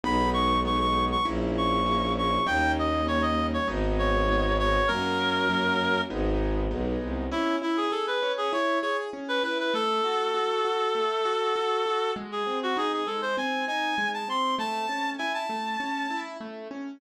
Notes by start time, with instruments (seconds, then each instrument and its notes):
0.04 violin B1, acoustic grand piano G#3 B3 D#4, clarinet B5
0.34 clarinet C#6
0.65 acoustic grand piano G#3 B3 D#4, clarinet C#6
0.80 clarinet C#6
1.12 clarinet C#6
1.25 violin A#1, acoustic grand piano A#3 C#4 E4
1.57 clarinet C#6
1.86 acoustic grand piano A#3 C#4 E4
2.18 clarinet C#6
2.47 violin D#2, acoustic grand piano G3 A#3 C#4 D#4, clarinet G5
2.79 clarinet D#5
3.07 acoustic grand piano G3 A#3 C#4 D#4, clarinet C#5
3.22 clarinet D#5
3.53 clarinet C#5
3.67 violin G#1, acoustic grand piano G#3 B3 D#4
3.99 clarinet C#5
4.28 acoustic grand piano G#3 B3 D#4
4.59 clarinet C#5
4.88 violin F#2, acoustic grand piano F#3 A#3 C#4, clarinet A#4
5.49 acoustic grand piano F#3 A#3 C#4
6.10 violin G#1, acoustic grand piano G#3 B3 D#4
6.70 violin B1, acoustic grand piano G#3 B3 D#4
7.02 violin C2
7.31 acoustic grand piano C#4, clarinet E4
7.62 acoustic grand piano E4, clarinet E4
7.77 clarinet G#4
7.91 acoustic grand piano G#4, clarinet A4
8.07 clarinet B4
8.22 acoustic grand piano C#4
8.38 clarinet G#4
8.53 acoustic grand piano E4, clarinet C#5
8.82 acoustic grand piano G#4, clarinet C#5
9.13 acoustic grand piano C#4
9.28 clarinet B4
9.44 acoustic grand piano E4, clarinet B4
9.59 clarinet B4
9.74 acoustic grand piano A3, clarinet A4
10.04 acoustic grand piano F#4
10.34 acoustic grand piano F#4
10.65 acoustic grand piano F#4
10.95 acoustic grand piano A3
11.25 acoustic grand piano F#4
11.56 acoustic grand piano F#4
11.86 acoustic grand piano F#4
12.16 acoustic grand piano G#3
12.32 clarinet G#4
12.46 acoustic grand piano C4
12.63 clarinet F#4
12.77 acoustic grand piano D#4, clarinet G#4
12.93 clarinet G#4
13.07 acoustic grand piano G#3, clarinet A4
13.22 clarinet C5
13.37 acoustic grand piano C4, clarinet G#5
13.68 acoustic grand piano D#4, clarinet G#5
13.98 acoustic grand piano G#3
14.14 clarinet A5
14.28 acoustic grand piano C4, clarinet C6
14.59 acoustic grand piano A3, clarinet A5
14.89 acoustic grand piano C#4
15.18 acoustic grand piano E4, clarinet G#5
15.34 clarinet A5
15.50 acoustic grand piano A3
15.80 acoustic grand piano C#4
16.10 acoustic grand piano E4
16.41 acoustic grand piano A3
16.71 acoustic grand piano C#4